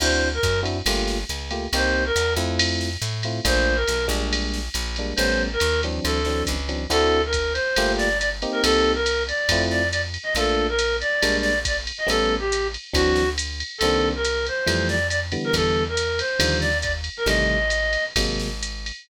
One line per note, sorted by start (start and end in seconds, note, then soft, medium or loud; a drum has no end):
0.00 0.39 D2 loud
0.00 0.29 C4 medium
0.00 0.29 D4 medium
0.00 0.29 E4 loud
0.00 0.29 F#4 medium
0.00 0.28 C5 medium
0.00 crash medium
0.00 ride medium
0.34 0.60 A#4 medium
0.43 0.82 F#2 loud
0.43 kick medium
0.43 hi-hat pedal medium
0.43 ride medium
0.63 0.78 C4 medium
0.63 0.78 D4 medium
0.63 0.78 E4 medium
0.63 0.78 F#4 medium
0.63 ride medium
0.86 1.25 G1 loud
0.86 1.18 A3 loud
0.86 1.18 A#3 loud
0.86 1.18 F4 loud
0.86 1.18 G4 medium
0.86 ride medium
1.08 snare medium
1.29 1.68 C#2 medium
1.29 hi-hat pedal medium
1.29 ride medium
1.51 1.66 A3 medium
1.51 1.66 A#3 medium
1.51 1.66 F4 medium
1.51 1.66 G4 medium
1.51 ride medium
1.73 2.12 C2 loud
1.73 2.04 A#3 loud
1.73 2.04 C4 medium
1.73 2.04 D#4 loud
1.73 2.04 G4 loud
1.73 2.04 C5 medium
1.73 ride medium
2.06 2.33 A#4 medium
2.16 2.36 E2 medium
2.16 hi-hat pedal medium
2.16 ride medium
2.37 2.97 F2 loud
2.37 2.89 A3 loud
2.37 2.89 C4 loud
2.37 2.89 E4 loud
2.37 2.89 F4 medium
2.37 ride medium
2.59 ride loud
2.81 snare soft
3.02 3.40 A2 loud
3.02 hi-hat pedal medium
3.02 ride medium
3.23 3.40 A3 medium
3.23 3.40 C4 medium
3.23 3.40 E4 medium
3.23 3.40 F4 medium
3.23 ride medium
3.45 3.84 A#1 loud
3.45 3.75 A3 medium
3.45 3.75 A#3 loud
3.45 3.75 D4 loud
3.45 3.75 F4 loud
3.45 3.77 C5 medium
3.45 kick medium
3.45 ride medium
3.76 4.06 A#4 medium
3.88 4.09 B1 medium
3.88 hi-hat pedal medium
3.88 ride medium
4.08 4.69 A#1 loud
4.08 4.60 G3 medium
4.08 4.60 G#3 loud
4.08 4.60 A#3 loud
4.08 4.60 D4 medium
4.08 ride medium
4.33 ride medium
4.54 snare medium
4.74 5.13 A#1 loud
4.74 hi-hat pedal medium
4.74 ride medium
4.96 5.14 G3 medium
4.96 5.14 G#3 medium
4.96 5.14 A#3 medium
4.96 5.14 D4 medium
4.96 ride medium
5.16 5.57 A1 loud
5.16 5.48 G3 loud
5.16 5.48 A3 medium
5.16 5.48 B3 loud
5.16 5.48 C#4 loud
5.16 5.43 C5 medium
5.16 ride medium
5.53 5.81 A#4 medium
5.60 6.00 D#2 loud
5.60 hi-hat pedal medium
5.60 ride medium
5.83 6.21 E3 medium
5.83 6.21 F#3 medium
5.83 6.21 C4 loud
5.83 6.21 D4 medium
5.83 ride medium
6.04 6.43 D2 loud
6.04 6.43 A4 medium
6.04 ride medium
6.25 6.56 E3 medium
6.25 6.56 F#3 medium
6.25 6.56 C4 medium
6.25 6.56 D4 medium
6.25 snare soft
6.47 6.87 C#2 loud
6.47 kick soft
6.47 hi-hat pedal medium
6.47 ride medium
6.69 6.84 E3 medium
6.69 6.84 F#3 medium
6.69 6.84 C4 medium
6.69 6.84 D4 medium
6.69 ride medium
6.90 7.59 D2 medium
6.90 7.20 C4 loud
6.90 7.20 D4 loud
6.90 7.20 E4 loud
6.90 7.20 F#4 loud
6.90 7.22 A4 medium
6.90 ride medium
7.26 7.53 A#4 medium
7.33 kick soft
7.33 hi-hat pedal medium
7.33 ride medium
7.53 7.92 C5 medium
7.53 ride medium
7.76 8.46 G1 medium
7.76 8.08 A3 loud
7.76 8.08 A#3 loud
7.76 8.08 F4 loud
7.76 8.08 G4 loud
7.76 ride medium
7.97 8.18 D5 medium
7.97 snare medium
8.19 8.29 D5 medium
8.19 hi-hat pedal medium
8.19 ride medium
8.42 8.94 A#3 loud
8.42 8.94 C4 loud
8.42 8.94 D#4 loud
8.42 8.94 G4 loud
8.42 ride medium
8.52 8.62 A#4 medium
8.63 9.33 C2 loud
8.63 8.92 A4 medium
8.63 ride loud
8.95 9.23 A#4 medium
9.06 hi-hat pedal medium
9.06 ride medium
9.28 9.63 D5 medium
9.28 ride medium
9.49 10.18 F2 medium
9.49 9.82 A3 loud
9.49 9.82 C4 loud
9.49 9.82 E4 loud
9.49 9.82 F4 loud
9.49 kick medium
9.49 ride loud
9.71 9.88 D5 medium
9.71 snare soft
9.91 10.01 D5 medium
9.91 hi-hat pedal medium
9.91 ride medium
10.14 ride medium
10.23 10.34 D#5 medium
10.35 11.04 A#1 medium
10.35 10.67 A3 loud
10.35 10.67 A#3 loud
10.35 10.67 D4 loud
10.35 10.67 F4 loud
10.35 10.67 A4 medium
10.35 ride medium
10.69 10.96 A#4 medium
10.79 hi-hat pedal medium
10.79 ride medium
11.01 11.37 D5 medium
11.01 ride medium
11.22 11.92 A#1 medium
11.22 11.53 G3 loud
11.22 11.53 G#3 loud
11.22 11.53 A#3 loud
11.22 11.53 D4 loud
11.22 ride medium
11.41 11.59 D5 medium
11.41 snare medium
11.65 11.77 D5 medium
11.65 kick medium
11.65 hi-hat pedal medium
11.65 ride medium
11.87 ride medium
11.98 12.08 D#5 medium
12.07 12.77 A1 medium
12.07 12.37 G3 loud
12.07 12.37 A3 loud
12.07 12.37 B3 loud
12.07 12.37 C#4 loud
12.07 12.35 A4 medium
12.07 ride medium
12.39 12.67 G4 medium
12.52 hi-hat pedal medium
12.52 ride medium
12.74 ride medium
12.93 13.63 D2 medium
12.93 13.24 E3 loud
12.93 13.24 F#3 loud
12.93 13.24 C4 loud
12.93 13.24 D4 loud
12.93 13.29 F#4 medium
12.93 kick medium
12.93 ride medium
13.16 snare medium
13.38 hi-hat pedal medium
13.38 ride medium
13.60 ride medium
13.78 14.50 C2 medium
13.78 14.09 A4 medium
13.78 ride medium
13.83 14.13 D#3 loud
13.83 14.13 A#3 loud
13.83 14.13 C4 loud
13.83 14.13 D4 loud
14.15 14.46 A#4 medium
14.25 hi-hat pedal medium
14.25 ride medium
14.46 14.88 C5 medium
14.46 ride medium
14.66 15.37 F2 medium
14.66 14.97 E3 loud
14.66 14.97 F3 loud
14.66 14.97 G3 loud
14.66 14.97 A3 loud
14.66 ride medium
14.89 15.07 D5 medium
14.89 snare medium
15.10 15.20 D5 medium
15.10 hi-hat pedal medium
15.10 ride medium
15.32 15.84 D3 loud
15.32 15.84 E3 loud
15.32 15.84 G3 loud
15.32 15.84 B3 loud
15.32 ride medium
15.44 15.55 A#4 medium
15.53 16.22 E2 medium
15.53 15.84 A4 medium
15.53 kick soft
15.53 ride medium
15.89 16.20 A#4 medium
15.97 hi-hat pedal medium
15.97 ride medium
16.19 16.58 C5 medium
16.19 ride medium
16.39 17.09 D#2 loud
16.39 16.70 D3 loud
16.39 16.70 D#3 loud
16.39 16.70 F3 loud
16.39 16.70 G3 loud
16.39 ride loud
16.60 16.78 D5 medium
16.60 snare soft
16.82 16.92 D5 medium
16.82 kick medium
16.82 hi-hat pedal medium
16.82 ride medium
17.04 ride medium
17.17 17.27 A#4 medium
17.26 17.97 A1 loud
17.26 17.57 C3 loud
17.26 17.57 D#3 loud
17.26 17.57 G3 loud
17.26 17.57 A3 loud
17.26 18.05 D#5 medium
17.26 ride medium
17.70 hi-hat pedal medium
17.70 ride medium
17.93 ride medium
18.16 18.92 G#1 medium
18.16 18.49 C3 loud
18.16 18.49 F#3 loud
18.16 18.49 G#3 loud
18.16 18.49 A#3 loud
18.16 kick medium
18.16 ride loud
18.40 snare medium
18.63 hi-hat pedal medium
18.63 ride medium
18.86 ride medium